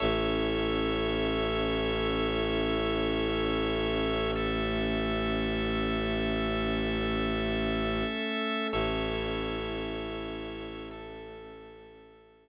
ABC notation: X:1
M:4/4
L:1/8
Q:1/4=55
K:A
V:1 name="Pad 2 (warm)"
[CEA]8 | [A,CA]8 | [CEA]4 [A,CA]4 |]
V:2 name="Drawbar Organ"
[Ace]8 | [Aea]8 | [Ace]4 [Aea]4 |]
V:3 name="Violin" clef=bass
A,,,8- | A,,,8 | A,,,8 |]